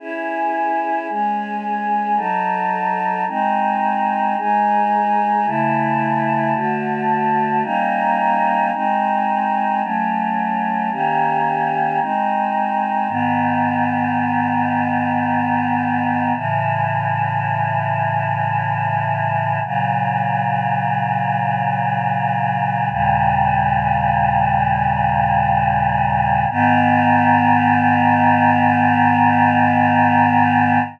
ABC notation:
X:1
M:3/4
L:1/8
Q:1/4=55
K:C#m
V:1 name="Choir Aahs"
[CEG]2 [G,CG]2 [F,DA]2 | [G,^B,D]2 [G,DG]2 [C,A,E]2 | [=D,A,F]2 [=G,^A,C^D]2 [^G,^B,D]2 | [F,A,C]2 [D,^A,C=G]2 [^G,^B,D]2 |
[K:G#m] [G,,D,B,]6 | [=A,,C,E,]6 | [A,,C,F,]6 | "^rit." [D,,A,,C,=G,]6 |
[G,,D,B,]6 |]